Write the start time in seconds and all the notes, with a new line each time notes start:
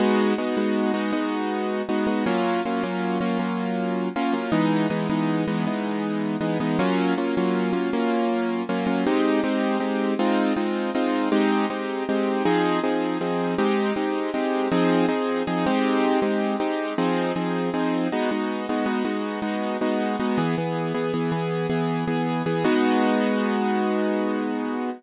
0.00 G#3 B3 D#4 F#4
0.38 G#3 B3 D#4 F#4
0.57 G#3 B3 D#4 F#4
0.94 G#3 B3 D#4 F#4
1.12 G#3 B3 D#4 F#4
1.89 G#3 B3 D#4 F#4
2.07 G#3 B3 D#4 F#4
2.26 F#3 A#3 C#4 F4
2.65 F#3 A#3 C#4 F4
2.83 F#3 A#3 C#4 F4
3.21 F#3 A#3 C#4 F4
3.39 F#3 A#3 C#4 F4
4.16 F#3 A#3 C#4 F4
4.33 F#3 A#3 C#4 F4
4.52 E3 G#3 B3 D#4
4.90 E3 G#3 B3 D#4
5.10 E3 G#3 B3 D#4
5.48 E3 G#3 B3 D#4
5.67 E3 G#3 B3 D#4
6.41 E3 G#3 B3 D#4
6.60 E3 G#3 B3 D#4
6.79 F#3 A#3 C#4 F4
7.18 F#3 A#3 C#4 F4
7.37 F#3 A#3 C#4 F4
7.73 F#3 A#3 C#4 F4
7.93 F#3 A#3 C#4 F4
8.69 F#3 A#3 C#4 F4
8.87 F#3 A#3 C#4 F4
9.07 G#3 C4 D#4 G4
9.44 G#3 C4 D#4 G4
9.80 G#3 C4 D#4 G4
10.19 G#3 C4 D#4 F4
10.56 G#3 C4 D#4 F4
10.95 G#3 C4 D#4 F4
11.32 G#3 C4 D#4 G4
11.70 G#3 C4 D#4 G4
12.09 G#3 C4 D#4 G4
12.45 F3 C4 D#4 G#4
12.84 F3 C4 D#4 G#4
13.21 F3 C4 D#4 G#4
13.58 G#3 C4 D#4 G4
13.96 G#3 C4 D#4 G4
14.34 G#3 C4 D#4 G4
14.72 F3 C4 D#4 G#4
15.08 F3 C4 D#4 G#4
15.47 F3 C4 D#4 G#4
15.66 G#3 C4 D#4 G4
16.22 G#3 C4 D#4 G4
16.60 G#3 C4 D#4 G4
16.98 F3 C4 D#4 G#4
17.36 F3 C4 D#4 G#4
17.74 F3 C4 D#4 G#4
18.12 G#3 B3 D#4 F#4
18.31 G#3 B3 D#4 F#4
18.69 G#3 B3 D#4 F#4
18.86 G#3 B3 D#4 F#4
19.05 G#3 B3 D#4 F#4
19.42 G#3 B3 D#4 F#4
19.81 G#3 B3 D#4 F#4
20.20 G#3 B3 D#4 F#4
20.38 E3 B3 G#4
20.58 E3 B3 G#4
20.94 E3 B3 G#4
21.14 E3 B3 G#4
21.32 E3 B3 G#4
21.70 E3 B3 G#4
22.07 E3 B3 G#4
22.46 E3 B3 G#4
22.64 G#3 B3 D#4 F#4